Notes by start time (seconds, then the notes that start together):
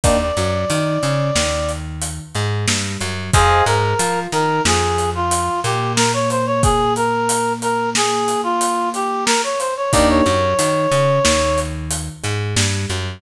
0.04 D#2 A#3 D4 D#4 G4 D5, kick, closed hi-hat
0.21 D5
0.37 F#2 F#3, closed hi-hat
0.70 D#3 D#4, closed hi-hat
1.03 C#3 C#4, closed hi-hat
1.35 D#2 D#3, snare
1.69 closed hi-hat
2.02 closed hi-hat
2.35 G#2 G#3, closed hi-hat
2.68 G2 G3, snare
3.01 F#2 F#3, closed hi-hat
3.34 F2 G#4 C5 D#5 F5 G#5, kick, closed hi-hat
3.66 G#2 G#3 A#4, closed hi-hat
3.99 F3 F4, closed hi-hat
4.32 D#3 D#4 A#4, closed hi-hat
4.65 F2 F3 G#4, snare
4.98 closed hi-hat
5.15 F4
5.31 closed hi-hat
5.64 A#2 A#3 G4, closed hi-hat
5.96 A#4, snare
6.13 C#5
6.30 C5, closed hi-hat
6.46 C#5
6.63 G#4, kick, closed hi-hat
6.96 A#4, closed hi-hat
7.29 closed hi-hat
7.62 A#4, closed hi-hat
7.95 G#4, snare
8.28 closed hi-hat
8.43 F4
8.61 closed hi-hat
8.94 G4, closed hi-hat
9.26 A#4, snare
9.44 C#5
9.59 C5, closed hi-hat
9.77 C#5
9.92 D#2 A#3 D4 D#4 G4 D5, kick, closed hi-hat
10.09 C#5
10.26 F#2 F#3, closed hi-hat
10.58 D#3 D#4, closed hi-hat
10.91 C#3 C#4, closed hi-hat
11.25 D#2 D#3, snare
11.58 closed hi-hat
11.91 closed hi-hat
12.23 G#2 G#3, closed hi-hat
12.56 G2 G3, snare
12.90 F#2 F#3, closed hi-hat